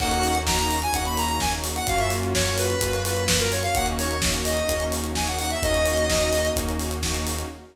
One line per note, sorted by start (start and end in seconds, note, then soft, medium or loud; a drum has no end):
0.00 0.86 D#2 medium
0.00 0.84 A#3 loud
0.00 1.86 A#3 medium
0.00 0.84 C#4 loud
0.00 1.86 C#4 medium
0.00 0.84 D#4 loud
0.00 1.86 D#4 medium
0.00 0.84 F#4 loud
0.00 1.86 F#4 medium
0.00 0.38 F#5 loud
0.00 kick medium
0.00 crash loud
0.11 closed hi-hat medium
0.23 open hi-hat medium
0.35 closed hi-hat medium
0.47 0.58 A#5 medium
0.47 kick medium
0.47 snare loud
0.59 0.79 A#5 medium
0.59 closed hi-hat medium
0.71 open hi-hat medium
0.82 0.93 G#5 loud
0.82 closed hi-hat medium
0.93 1.80 D#2 medium
0.93 1.78 A#3 loud
0.93 1.78 C#4 loud
0.93 1.78 D#4 loud
0.93 1.78 F#4 loud
0.93 1.05 F#5 medium
0.93 kick medium
0.93 closed hi-hat medium
1.05 1.17 B5 medium
1.05 closed hi-hat medium
1.17 1.28 A#5 medium
1.17 open hi-hat medium
1.29 1.40 A#5 medium
1.29 closed hi-hat medium
1.40 1.52 G#5 loud
1.40 kick medium
1.40 snare medium
1.53 closed hi-hat medium
1.64 open hi-hat medium
1.76 1.87 F#5 loud
1.76 closed hi-hat medium
1.87 2.74 F#2 medium
1.87 2.72 A#3 loud
1.87 3.74 A#3 medium
1.87 2.72 C#4 loud
1.87 3.74 C#4 medium
1.87 2.72 F4 loud
1.87 3.74 F4 medium
1.87 2.72 F#4 loud
1.87 3.74 F#4 medium
1.87 1.99 F5 loud
1.87 kick loud
1.87 closed hi-hat medium
1.99 2.10 E5 loud
1.99 closed hi-hat medium
2.10 open hi-hat medium
2.23 closed hi-hat medium
2.34 2.56 C#5 medium
2.34 kick medium
2.34 snare loud
2.46 closed hi-hat medium
2.58 3.02 B4 medium
2.58 open hi-hat medium
2.70 closed hi-hat medium
2.81 3.68 F#2 medium
2.81 3.66 A#3 loud
2.81 3.66 C#4 medium
2.81 3.66 F4 loud
2.81 3.66 F#4 medium
2.81 kick medium
2.81 closed hi-hat loud
2.93 closed hi-hat medium
3.05 3.24 B4 medium
3.05 open hi-hat medium
3.17 closed hi-hat medium
3.28 3.39 B4 medium
3.28 kick medium
3.28 snare loud
3.40 3.51 A#4 medium
3.40 closed hi-hat medium
3.52 3.63 C#5 medium
3.52 open hi-hat medium
3.63 3.74 F5 loud
3.63 closed hi-hat medium
3.75 4.61 D#2 medium
3.75 4.17 A#3 loud
3.75 5.61 A#3 medium
3.75 4.17 C#4 loud
3.75 5.61 C#4 medium
3.75 4.17 D#4 loud
3.75 5.61 D#4 medium
3.75 4.17 F#4 loud
3.75 5.61 F#4 medium
3.75 3.86 F#5 loud
3.75 kick loud
3.75 closed hi-hat medium
3.86 closed hi-hat medium
3.98 4.21 C#5 medium
3.98 open hi-hat medium
4.11 closed hi-hat medium
4.22 4.64 A#3 loud
4.22 4.64 C#4 loud
4.22 4.64 D#4 loud
4.22 4.64 F#4 loud
4.22 kick medium
4.22 snare loud
4.34 closed hi-hat medium
4.45 4.84 D#5 medium
4.45 open hi-hat medium
4.57 closed hi-hat medium
4.69 5.55 D#2 medium
4.69 5.11 A#3 medium
4.69 5.11 C#4 loud
4.69 5.11 D#4 loud
4.69 5.11 F#4 medium
4.69 kick medium
4.69 closed hi-hat medium
4.80 closed hi-hat medium
4.92 open hi-hat medium
5.04 closed hi-hat medium
5.15 5.58 A#3 medium
5.15 5.58 C#4 medium
5.15 5.58 D#4 loud
5.15 5.58 F#4 medium
5.15 5.27 G#5 medium
5.15 kick medium
5.15 snare medium
5.27 5.38 F#5 medium
5.27 closed hi-hat medium
5.39 5.50 F#5 loud
5.39 open hi-hat medium
5.50 5.62 E5 medium
5.50 closed hi-hat medium
5.62 6.49 D#2 medium
5.62 7.48 A#3 medium
5.62 6.05 A#3 loud
5.62 7.48 C#4 medium
5.62 6.05 C#4 loud
5.62 7.48 D#4 medium
5.62 6.05 D#4 loud
5.62 7.48 F#4 medium
5.62 6.05 F#4 loud
5.62 6.49 D#5 loud
5.62 kick loud
5.62 closed hi-hat medium
5.74 closed hi-hat medium
5.86 open hi-hat medium
5.97 closed hi-hat medium
6.09 6.51 A#3 medium
6.09 6.51 C#4 loud
6.09 6.51 D#4 loud
6.09 6.51 F#4 loud
6.09 kick medium
6.09 snare loud
6.21 closed hi-hat medium
6.33 open hi-hat medium
6.45 closed hi-hat medium
6.56 7.42 D#2 medium
6.56 6.99 A#3 loud
6.56 6.99 C#4 loud
6.56 6.99 D#4 loud
6.56 6.99 F#4 loud
6.56 kick medium
6.56 closed hi-hat loud
6.69 closed hi-hat medium
6.79 open hi-hat medium
6.91 closed hi-hat medium
7.03 7.45 A#3 medium
7.03 7.45 C#4 medium
7.03 7.45 D#4 loud
7.03 7.45 F#4 loud
7.03 kick medium
7.03 snare medium
7.14 closed hi-hat medium
7.27 open hi-hat medium
7.39 closed hi-hat medium